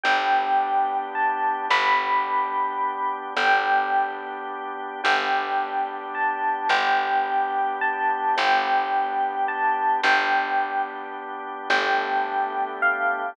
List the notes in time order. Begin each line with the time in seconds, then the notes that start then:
0.03 G1 B3 D4 G4 G5
1.15 A5
1.69 G1 B3 D4 G4 B5
3.37 G1 B3 D4 G4 G5
5.03 G1 B3 D4 G4 G5
6.15 A5
6.69 G1 B3 D4 G4 G5
7.81 A5
8.36 G1 B3 D4 G4 G5
9.48 A5
10.03 G1 B3 D4 G4 G5
11.69 G1 A3 B3 D4 G4 G5
12.82 F5